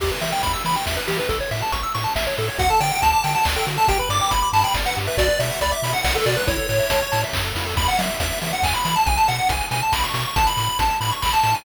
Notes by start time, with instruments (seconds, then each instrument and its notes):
0.00 synth bass 1 E2, lead 1 (square) G4, kick, crash
0.11 lead 1 (square) B4
0.21 synth bass 1 E3, lead 1 (square) E5, open hi-hat
0.32 lead 1 (square) G5
0.43 synth bass 1 E2, lead 1 (square) B5, kick, closed hi-hat
0.53 lead 1 (square) E6
0.64 synth bass 1 E3, lead 1 (square) B5, open hi-hat
0.76 lead 1 (square) G5
0.86 synth bass 1 E2, lead 1 (square) E5, kick, snare
0.97 lead 1 (square) B4
1.08 synth bass 1 E3, lead 1 (square) G4, open hi-hat
1.19 lead 1 (square) B4
1.29 synth bass 1 A1, lead 1 (square) A4, kick, closed hi-hat
1.40 lead 1 (square) C#5
1.51 synth bass 1 A2, lead 1 (square) E5, open hi-hat
1.62 lead 1 (square) A5
1.72 synth bass 1 A1, lead 1 (square) C#6, kick, closed hi-hat
1.83 lead 1 (square) E6
1.95 synth bass 1 A2, lead 1 (square) C#6, open hi-hat
2.04 lead 1 (square) A5
2.15 synth bass 1 A1, lead 1 (square) E5, kick, snare
2.27 lead 1 (square) C#5
2.37 synth bass 1 A2, lead 1 (square) A4, open hi-hat
2.48 lead 1 (square) C#5
2.58 synth bass 1 D2, lead 1 (square) F#4 F#5, kick, closed hi-hat
2.70 lead 1 (square) A4 A5
2.80 synth bass 1 D3, lead 1 (square) D5 G5, open hi-hat
2.91 lead 1 (square) F#5
3.02 synth bass 1 D2, lead 1 (square) A5, kick, closed hi-hat
3.13 lead 1 (square) D6
3.23 synth bass 1 D3, lead 1 (square) G5 A5, open hi-hat
3.35 lead 1 (square) F#5 A5
3.45 synth bass 1 D2, lead 1 (square) D5, kick, clap
3.56 lead 1 (square) A4 G5
3.67 synth bass 1 D3, lead 1 (square) F#4, open hi-hat
3.77 lead 1 (square) A4 A5
3.88 synth bass 1 G1, lead 1 (square) G4 G5, kick, closed hi-hat
3.99 lead 1 (square) B4 B5
4.09 synth bass 1 G2, lead 1 (square) D5 D6, open hi-hat
4.21 lead 1 (square) G5
4.30 synth bass 1 G1, lead 1 (square) B5, kick, closed hi-hat
4.42 lead 1 (square) D6
4.53 synth bass 1 G2, lead 1 (square) A5 B5, open hi-hat
4.64 lead 1 (square) G5 B5
4.74 synth bass 1 G1, lead 1 (square) D5, kick, snare
4.86 lead 1 (square) B4 F#5
4.96 synth bass 1 G2, lead 1 (square) G4, open hi-hat
5.07 lead 1 (square) B4 E5
5.17 synth bass 1 B1, lead 1 (square) F#4 D5, kick, closed hi-hat
5.29 lead 1 (square) B4
5.39 synth bass 1 B2, lead 1 (square) D5 E5, open hi-hat
5.50 lead 1 (square) F#5
5.61 synth bass 1 C#2, lead 1 (square) D5 B5, kick, closed hi-hat
5.71 lead 1 (square) E5 D6
5.82 synth bass 1 B2, lead 1 (square) B5, open hi-hat
5.93 lead 1 (square) F#5
6.04 synth bass 1 B1, lead 1 (square) D5 F#5, kick, snare
6.15 lead 1 (square) A4 B4
6.25 synth bass 1 B2, lead 1 (square) F#4 D5, open hi-hat
6.36 lead 1 (square) B4
6.47 synth bass 1 A1, lead 1 (square) E4 C#5, kick, closed hi-hat
6.57 lead 1 (square) A4
6.69 synth bass 1 A2, lead 1 (square) C#5, open hi-hat
6.79 lead 1 (square) E5
6.90 synth bass 1 A1, lead 1 (square) A5, kick, closed hi-hat
7.02 lead 1 (square) C#6
7.12 synth bass 1 A2, lead 1 (square) A5, open hi-hat
7.24 lead 1 (square) E5
7.33 synth bass 1 F#2, lead 1 (square) C#5, kick, clap
7.45 lead 1 (square) A4
7.55 synth bass 1 F2, lead 1 (square) E4, open hi-hat
7.66 lead 1 (square) A4
7.77 synth bass 1 E2, lead 1 (square) B5, kick, crash
7.88 lead 1 (square) F#5, closed hi-hat
7.99 synth bass 1 F#3, lead 1 (square) E5, open hi-hat
8.09 closed hi-hat
8.20 synth bass 1 E2, lead 1 (square) E5, kick, closed hi-hat
8.31 closed hi-hat
8.42 synth bass 1 E3, lead 1 (square) E5, open hi-hat
8.53 lead 1 (square) F#5, closed hi-hat
8.62 synth bass 1 E2, lead 1 (square) G#5, kick, clap
8.74 lead 1 (square) B5, closed hi-hat
8.85 synth bass 1 E3, lead 1 (square) B5, open hi-hat
8.96 lead 1 (square) A5, closed hi-hat
9.06 synth bass 1 B1, lead 1 (square) G#5, kick, closed hi-hat
9.17 lead 1 (square) A5, closed hi-hat
9.28 synth bass 1 B2, lead 1 (square) F#5, open hi-hat
9.38 closed hi-hat
9.49 synth bass 1 B1, lead 1 (square) G#5, kick, closed hi-hat
9.61 closed hi-hat
9.71 synth bass 1 B2, lead 1 (square) G#5, open hi-hat
9.82 lead 1 (square) A5, closed hi-hat
9.92 synth bass 1 B1, lead 1 (square) B5, kick, snare
10.04 lead 1 (square) C#6, closed hi-hat
10.14 synth bass 1 B2, lead 1 (square) C#6, open hi-hat
10.25 lead 1 (square) C#6, closed hi-hat
10.36 synth bass 1 A1, lead 1 (square) A5, kick, closed hi-hat
10.47 lead 1 (square) B5, closed hi-hat
10.57 synth bass 1 A2, open hi-hat
10.69 closed hi-hat
10.79 synth bass 1 A1, lead 1 (square) A5, kick, closed hi-hat
10.90 closed hi-hat
11.01 synth bass 1 A2, lead 1 (square) B5, open hi-hat
11.12 lead 1 (square) C#6, closed hi-hat
11.22 synth bass 1 A1, lead 1 (square) B5, kick, clap
11.33 lead 1 (square) A5, closed hi-hat
11.43 synth bass 1 A2, lead 1 (square) A5, open hi-hat
11.54 lead 1 (square) G#5, open hi-hat